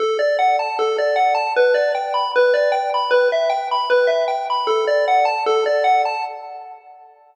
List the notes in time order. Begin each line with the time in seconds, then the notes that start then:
0.00 A4
0.19 D5
0.39 F#5
0.59 A5
0.79 A4
0.98 D5
1.16 F#5
1.35 A5
1.56 B4
1.74 D5
1.95 G5
2.14 B5
2.36 B4
2.54 D5
2.72 G5
2.94 B5
3.11 B4
3.32 E5
3.50 G5
3.71 B5
3.90 B4
4.07 E5
4.28 G5
4.50 B5
4.67 A4
4.87 D5
5.08 F#5
5.25 A5
5.46 A4
5.66 D5
5.84 F#5
6.05 A5